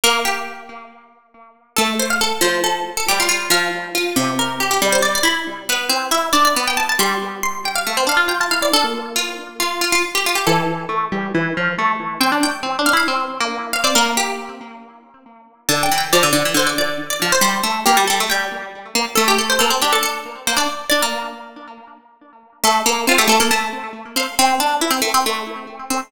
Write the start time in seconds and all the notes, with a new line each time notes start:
0.04 A#3 A#4
0.25 G4
1.77 A3 A4
2.00 C5
2.10 F5
2.21 A4
2.41 F3 C5
2.64 A4
2.97 A4
3.09 G3 G4
3.20 F4
3.29 F4
3.50 F3 F5
3.95 F4
4.16 C3
4.39 A#4
4.60 G4
4.71 G4
4.82 G3
4.92 C5
5.02 D5
5.15 D5
5.23 E4 B5
5.69 B3 B4
5.89 C4
6.11 E4 E5
6.33 D4 D5
6.45 D5
6.56 B3
6.68 G5
6.77 A5
6.89 A5
6.99 G3 C6
7.43 C6
7.65 G5
7.76 F5
7.87 A3
7.97 C4
8.07 D4 F5
8.17 F4
8.28 F4 G5
8.40 F4 A5
8.51 E4 F5
8.61 E4 D5
8.73 D4 A4
8.84 A#3
9.16 F4
9.60 F4
9.81 F4
9.92 F4
10.15 G4
10.26 F4
10.35 G4
10.47 E3 A4
10.89 A3
11.12 G3
11.35 E3
11.57 F3
11.79 A3
12.20 C4 G5
12.32 D4
12.43 G5
12.63 C4
12.79 D4
12.86 F5
12.93 E4 F5
13.08 C4
13.40 A#3
13.73 F5
13.84 C4 D5
13.95 A#3 A#4
14.17 G4
15.69 D3 A5
15.83 G5
15.92 E3
15.98 G5
16.13 F3 D5
16.23 D3
16.33 D3 D5
16.45 E3
16.54 D3 C5
16.67 D5
16.78 D5
17.10 D5
17.22 F3
17.32 C5
17.41 G3 C5
17.63 A3
17.86 A#3 G4
17.97 G3
18.08 G3 A4
18.20 A3
18.30 G3 G5
18.95 A#3
19.15 A3 A4
19.28 G4
19.38 A4
19.50 C5
19.59 A#3 A4
19.70 C4
19.82 D4 G4
19.93 A4
20.03 A4
20.47 A#3 C5
20.57 D4 D5
20.90 D4 D5
21.02 A#3
22.64 A3 A4
22.86 A#3 A4
23.07 C4 F4
23.18 A3 G4
23.28 A3 A4
23.40 A#3 A4
23.51 A3 A5
24.16 C4 F5
24.39 C4 C6
24.60 D4
24.81 E4
24.91 C4
25.02 A3
25.14 C4
25.26 A3
25.90 C4